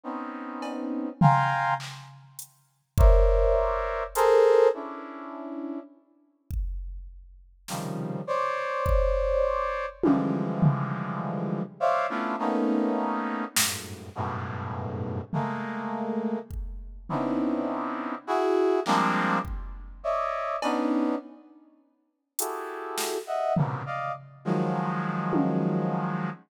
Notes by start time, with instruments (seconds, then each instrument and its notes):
0.03 brass section B3 C4 C#4 D#4
0.62 cowbell
1.21 brass section F5 G5 G#5 A#5 C6, floor tom
1.80 clap
2.39 closed hi-hat
2.98 brass section A#4 C5 C#5 D5 E5, kick
4.15 brass section G#4 A4 A#4 C5, closed hi-hat
4.74 brass section C#4 D4 E4
6.50 kick
7.68 brass section C3 C#3 D#3 F3 G3, snare
8.27 brass section C5 C#5 D5
8.86 kick
10.03 brass section D3 E3 F3 G3 G#3, high tom
10.62 floor tom
11.80 brass section C5 C#5 D5 E5 F5
12.09 brass section A3 B3 C#4 D4 E4 F4
12.39 brass section A3 A#3 B3 C#4 D#4
13.56 brass section F#2 G2 G#2 A2, snare
14.15 brass section F#2 G2 G#2 A2 B2
15.33 brass section G#3 A3 A#3, floor tom
16.50 kick
17.09 brass section B3 C4 C#4 D4 D#4 E4, floor tom
18.27 brass section E4 F#4 G#4
18.86 brass section F3 G3 G#3 A#3 C4 D4, clap
19.45 kick
20.03 brass section C#5 D5 D#5 E5
20.62 brass section B3 C#4 D4 D#4, cowbell
22.39 brass section E4 F#4 G4 G#4 A4, closed hi-hat
22.98 snare
23.27 brass section D#5 E5 F#5
23.56 brass section G#2 A#2 B2 C3 C#3, floor tom
23.86 brass section D5 D#5 F5
24.45 brass section D#3 F3 F#3 G#3
25.33 high tom